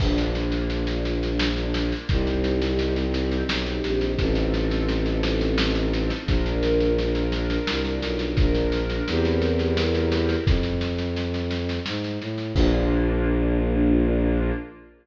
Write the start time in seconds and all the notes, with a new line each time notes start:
0.00 A#1 A#3 D4 F4, kick, snare, crash
0.18 snare
0.35 snare
0.52 snare
0.70 snare
0.87 snare
1.05 snare
1.23 snare
1.39 snare
1.57 snare
1.74 snare
1.92 snare
2.09 C2 C4 D#4 G4, kick, snare
2.27 snare
2.44 snare
2.62 snare
2.79 snare
2.96 snare
3.14 snare
3.32 snare
3.49 B1, snare
3.66 snare
3.84 A#1, snare
4.01 snare
4.18 A1 C4 D#4 F4 A4, kick, snare
4.35 snare
4.54 snare
4.71 snare
4.89 snare
5.06 snare
5.23 snare
5.41 snare
5.58 snare
5.75 snare
5.93 snare
6.10 snare
6.26 A#1 D4 F4 A#4, kick, snare
6.46 snare
6.63 snare
6.80 snare
6.98 snare
7.15 snare
7.32 snare
7.50 snare
7.67 C2, snare
7.85 snare
8.02 B1, snare
8.19 snare
8.37 A#1 D4 F4 A#4, kick, snare
8.55 snare
8.72 snare
8.90 snare
9.07 E2 C4 E4 G4 A#4, snare
9.25 snare
9.42 snare
9.59 snare
9.77 snare
9.95 snare
10.12 snare
10.29 snare
10.46 F2, kick, snare
10.63 snare
10.81 snare
10.98 snare
11.16 snare
11.34 snare
11.51 snare
11.69 snare
11.86 G#2, snare
12.04 snare
12.21 A2, snare
12.38 snare
12.54 A#1 A#3 D4 F4, kick, crash